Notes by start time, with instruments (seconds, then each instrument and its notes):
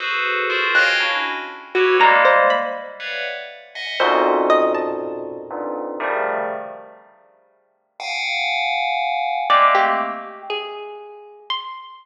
0.00 tubular bells F#4 G#4 A4 B4 C5
0.50 tubular bells F4 F#4 G#4 A#4 C5
0.75 tubular bells C#5 D#5 F5 G5 G#5, orchestral harp F#6
1.00 tubular bells C#4 D4 E4 F#4
1.75 tubular bells E4 F#4 G4 A4 B4 C#5, orchestral harp F#4
2.00 tubular bells G3 G#3 A#3, orchestral harp A#5
2.25 orchestral harp C5
2.50 orchestral harp B5
3.00 tubular bells B4 C#5 D5 E5 F5 F#5
3.75 tubular bells D#5 E5 F#5 G#5
4.00 tubular bells F2 F#2 G#2 A#2 B2, orchestral harp C5
4.50 orchestral harp D#5
4.75 orchestral harp A5
5.51 tubular bells F2 G2 G#2 A#2
6.00 tubular bells C3 C#3 D#3 F3 G3 A3
8.00 tubular bells F5 F#5 G5 G#5
9.50 tubular bells G#3 A3 A#3 C4, orchestral harp D5
9.75 orchestral harp G4
10.50 orchestral harp G#4
11.50 orchestral harp C6